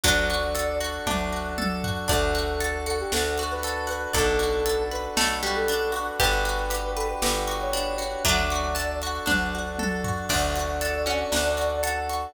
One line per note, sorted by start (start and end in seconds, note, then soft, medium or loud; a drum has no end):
0.04 0.99 D2 medium
0.04 0.99 F#3 medium
0.04 2.07 D4 medium
0.04 1.06 D4 loud
0.04 2.07 F#4 medium
0.04 2.07 A4 medium
0.04 0.75 D5 medium
0.04 kick medium
0.04 closed hi-hat loud
0.30 0.80 F#4 medium
0.30 closed hi-hat medium
0.55 1.57 A4 medium
0.55 closed hi-hat medium
0.80 1.32 F#4 medium
0.80 closed hi-hat medium
1.07 2.01 D2 medium
1.07 1.49 D4 medium
1.07 2.04 D4 medium
1.07 kick medium
1.07 high tom medium
1.33 1.84 F#4 medium
1.58 2.07 A4 medium
1.58 high tom medium
1.84 2.08 F#4 medium
1.84 floor tom medium
2.08 3.04 D2 medium
2.08 2.34 D4 medium
2.08 4.12 D4 medium
2.08 4.12 F#4 medium
2.08 4.12 A4 medium
2.08 2.76 A4 medium
2.08 3.93 D5 medium
2.08 kick medium
2.08 closed hi-hat medium
2.35 2.60 F#4 medium
2.35 closed hi-hat medium
2.61 2.86 A4 medium
2.61 closed hi-hat medium
2.86 3.12 F#4 medium
2.86 2.98 A4 medium
2.86 closed hi-hat medium
3.00 3.12 G4 medium
3.12 4.07 D2 medium
3.12 3.38 D4 medium
3.12 3.43 A4 medium
3.12 snare medium
3.38 3.65 F#4 medium
3.38 closed hi-hat medium
3.51 3.88 B4 medium
3.63 3.90 A4 medium
3.63 closed hi-hat medium
3.87 4.11 F#4 medium
3.87 4.10 B4 medium
3.87 closed hi-hat medium
4.13 5.09 B1 medium
4.13 4.39 D4 medium
4.13 6.19 D4 medium
4.13 6.19 F#4 medium
4.13 4.83 A4 medium
4.13 5.01 A4 medium
4.13 6.19 A4 medium
4.13 6.19 B4 medium
4.13 kick medium
4.13 closed hi-hat medium
4.39 4.65 F#4 medium
4.39 closed hi-hat medium
4.66 4.91 A4 medium
4.66 closed hi-hat medium
4.91 5.17 B4 medium
4.91 5.04 B4 medium
4.91 closed hi-hat soft
5.17 6.11 B1 medium
5.17 5.39 A3 medium
5.17 5.43 A4 medium
5.17 snare medium
5.43 5.68 G3 medium
5.43 5.69 F#4 medium
5.43 closed hi-hat medium
5.56 5.91 A4 medium
5.68 5.95 D4 medium
5.68 closed hi-hat medium
5.92 6.17 F#4 medium
5.92 closed hi-hat medium
6.19 7.15 G1 medium
6.19 8.22 D4 medium
6.19 6.46 D4 medium
6.19 8.22 F#4 medium
6.19 8.22 G4 medium
6.19 8.18 G4 medium
6.19 8.22 B4 medium
6.19 6.92 B4 medium
6.19 kick medium
6.19 closed hi-hat medium
6.45 6.71 F#4 medium
6.45 closed hi-hat medium
6.70 6.96 G4 medium
6.70 closed hi-hat medium
6.96 7.08 A4 medium
6.96 7.22 B4 medium
6.96 closed hi-hat medium
7.09 7.21 B4 medium
7.22 8.16 G1 medium
7.22 7.48 G4 medium
7.22 7.53 B4 medium
7.22 snare loud
7.47 7.73 F#4 medium
7.47 closed hi-hat medium
7.61 7.96 C#5 medium
7.73 7.99 D4 medium
7.73 closed hi-hat medium
7.98 8.23 F#4 medium
7.98 8.24 C#5 medium
7.98 closed hi-hat medium
8.25 9.19 D2 medium
8.25 9.20 F#3 medium
8.25 10.28 D4 medium
8.25 8.51 D4 loud
8.25 10.28 F#4 medium
8.25 10.28 A4 medium
8.25 8.95 D5 medium
8.25 kick medium
8.25 closed hi-hat loud
8.50 8.77 F#4 medium
8.50 closed hi-hat medium
8.75 9.01 A4 medium
8.75 closed hi-hat medium
9.02 9.29 F#4 medium
9.02 closed hi-hat medium
9.26 10.22 D2 medium
9.26 9.51 D4 medium
9.26 9.69 D4 medium
9.26 kick medium
9.26 high tom medium
9.55 9.80 F#4 medium
9.79 10.05 A4 medium
9.79 high tom medium
10.04 10.29 F#4 medium
10.04 floor tom medium
10.29 11.24 D2 medium
10.29 12.32 D4 medium
10.29 11.31 D4 medium
10.29 10.97 D4 medium
10.29 12.32 F#4 medium
10.29 12.32 A4 medium
10.29 11.77 D5 medium
10.29 kick medium
10.29 crash medium
10.56 11.05 F#4 medium
10.56 closed hi-hat medium
10.81 11.82 A4 medium
10.81 closed hi-hat medium
11.06 12.23 C#4 medium
11.06 11.57 F#4 medium
11.06 closed hi-hat soft
11.32 12.27 D2 medium
11.32 12.29 D4 medium
11.32 snare medium
11.57 12.09 F#4 medium
11.57 closed hi-hat medium
11.83 12.32 A4 medium
11.83 12.32 F#5 medium
11.83 closed hi-hat medium
12.10 12.34 F#4 medium
12.10 closed hi-hat medium